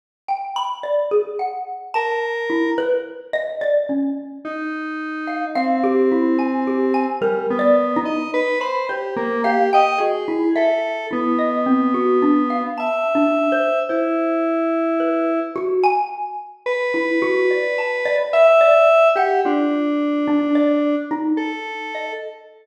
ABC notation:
X:1
M:5/8
L:1/16
Q:1/4=54
K:none
V:1 name="Lead 1 (square)"
z7 ^A3 | z6 ^D4 | C6 G, B,2 ^d | B c G ^A, G ^d ^G2 =A2 |
B,6 e4 | E6 z4 | B6 e3 G | D6 z A3 |]
V:2 name="Xylophone"
z g b d ^G ^f2 a2 E | B2 ^d =d ^C2 z3 f | f G E ^g =G ^g (3^A2 d2 ^D2 | z b c z f g ^F E e2 |
E ^d C ^F =D =f (3a2 D2 c2 | c4 B2 ^F ^g3 | z E ^F d a d e d2 ^f | F3 D d2 ^D3 ^d |]